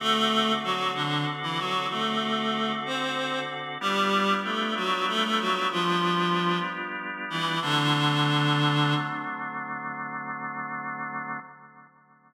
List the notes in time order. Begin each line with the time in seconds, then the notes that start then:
0.00 D3 A3 C4 F#4 A4
0.64 F#3 F#4
0.95 D3 D4
1.43 E3 E4
1.59 F#3 F#4
1.90 A3 A4
2.86 C4 C5
3.81 G3 B3 D4 F4 G4
4.44 A3 A4
4.76 F#3 F#4
5.08 A3 A4
5.24 A3 A4
5.40 F#3 F#4
5.71 F3 F4
7.30 E3 E4
7.62 D3 F#3 A3 C4 D4